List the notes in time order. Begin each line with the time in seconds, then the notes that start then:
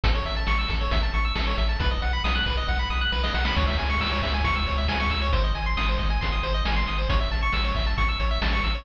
0.04 A1 A4, kick, closed hi-hat
0.15 C#5
0.25 A1 E5, closed hi-hat
0.36 A5
0.47 A1 C#6, snare
0.59 E6
0.68 A1 A4, kick, snare, closed hi-hat
0.81 C#5
0.91 A1 E5, kick, closed hi-hat
1.03 A5
1.14 A1 C#6, closed hi-hat
1.25 E6
1.35 A1 A4, snare
1.47 C#5
1.58 A1 E5, closed hi-hat
1.69 A5
1.80 B1 B4, kick, closed hi-hat
1.91 D#5
2.02 B1 F#5, closed hi-hat
2.13 B5
2.24 B1 D#6, snare
2.35 F#6
2.46 B1 B4, kick, snare, closed hi-hat
2.57 D#5
2.68 B1 F#5, kick, snare
2.79 B5
2.90 B1 D#6, snare
3.01 F#6
3.12 B1 B4, snare
3.23 D#5, snare
3.34 B1 F#5, snare
3.45 B5, snare
3.56 C#2 C#5, kick, crash
3.67 E5
3.77 C#2 G#5, closed hi-hat
3.90 C#6
4.01 C#2 E6, snare
4.12 C#5
4.22 C#2 E5, kick, snare, closed hi-hat
4.34 G#5
4.44 C#2 C#6, kick, closed hi-hat
4.56 E6
4.67 C#2 C#5, closed hi-hat
4.78 E5
4.88 C#2 G#5, snare
5.00 C#6
5.10 C#2 E6, closed hi-hat
5.22 C#5
5.33 G#1 C5, kick, closed hi-hat
5.44 D#5
5.55 G#1 G#5, closed hi-hat
5.66 C6
5.77 G#1 D#6, snare
5.88 C5
5.98 G#1 D#5, kick, snare, closed hi-hat
6.10 G#5
6.21 G#1 C6, kick, closed hi-hat
6.32 D#6
6.43 G#1 C5, closed hi-hat
6.54 D#5
6.65 G#1 G#5, snare
6.76 C6
6.86 G#1 D#6, closed hi-hat
6.98 C5
7.09 A1 C#5, kick, closed hi-hat
7.20 E5
7.31 A1 A5, closed hi-hat
7.42 C#6
7.52 A1 E6, snare
7.65 C#5
7.75 A1 E5, kick, snare, closed hi-hat
7.86 A5
7.98 A1 C#6, kick, closed hi-hat
8.09 E6
8.20 A1 C#5, closed hi-hat
8.31 E5
8.42 A1 A5, snare
8.53 C#6
8.64 A1 E6, closed hi-hat
8.75 C#5